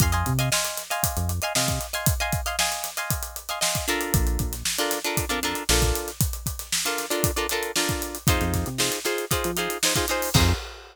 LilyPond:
<<
  \new Staff \with { instrumentName = "Acoustic Guitar (steel)" } { \time 4/4 \key f \dorian \tempo 4 = 116 <ees'' f'' aes'' c'''>16 <ees'' f'' aes'' c'''>8 <ees'' f'' aes'' c'''>16 <ees'' f'' aes'' c'''>8. <ees'' f'' aes'' c'''>4 <ees'' f'' aes'' c'''>16 <ees'' f'' aes'' c'''>8. <ees'' f'' aes'' c'''>16~ | <ees'' f'' aes'' c'''>16 <ees'' f'' aes'' c'''>8 <ees'' f'' aes'' c'''>16 <ees'' f'' aes'' c'''>8. <ees'' f'' aes'' c'''>4 <ees'' f'' aes'' c'''>16 <ees'' f'' aes'' c'''>8 <d' f' a' bes'>8~ | <d' f' a' bes'>4~ <d' f' a' bes'>16 <d' f' a' bes'>8 <d' f' a' bes'>8 <d' f' a' bes'>16 <d' f' a' bes'>8 <d' f' a' bes'>4~ | <d' f' a' bes'>4~ <d' f' a' bes'>16 <d' f' a' bes'>8 <d' f' a' bes'>8 <d' f' a' bes'>16 <d' f' a' bes'>8 <d' f' a' bes'>4 |
<ees' f' aes' c''>4 <ees' f' aes' c''>8 <ees' f' aes' c''>8 <ees' f' aes' c''>8 <ees' f' aes' c''>8 <ees' f' aes' c''>16 <ees' f' aes' c''>16 <ees' f' aes' c''>8 | <ees' f' aes' c''>4 r2. | }
  \new Staff \with { instrumentName = "Synth Bass 1" } { \clef bass \time 4/4 \key f \dorian f,8 c4.~ c16 f,8. c4~ | c1 | bes,,8 bes,,4.~ bes,,16 f,8. bes,,4~ | bes,,1 |
f,16 f,8 c4. f4.~ f16 | f,4 r2. | }
  \new DrumStaff \with { instrumentName = "Drums" } \drummode { \time 4/4 <hh bd>16 hh16 <hh bd>16 hh16 sn16 hh16 <hh sn>16 hh16 <hh bd>16 hh16 hh16 hh16 sn16 <hh bd sn>16 hh16 hh16 | <hh bd>16 hh16 <hh bd>16 hh16 sn16 hh16 <hh sn>16 hh16 <hh bd>16 hh16 hh16 hh16 sn16 <hh bd>16 hh16 hh16 | <hh bd>16 hh16 <hh bd>16 <hh sn>16 sn16 hh16 <hh sn>16 hh16 <hh bd>16 hh16 <hh sn>16 hh16 sn16 <hh bd>16 <hh sn>16 <hh sn>16 | <hh bd>16 hh16 <hh bd>16 <hh sn>16 sn16 hh16 <hh sn>16 hh16 <hh bd>16 hh16 hh16 hh16 sn16 <hh bd>16 hh16 hh16 |
<hh bd>16 <hh sn>16 <hh bd sn>16 hh16 sn16 <hh sn>16 <hh sn>16 hh16 <hh bd>16 hh16 hh16 hh16 sn16 <hh bd>16 hh16 hho16 | <cymc bd>4 r4 r4 r4 | }
>>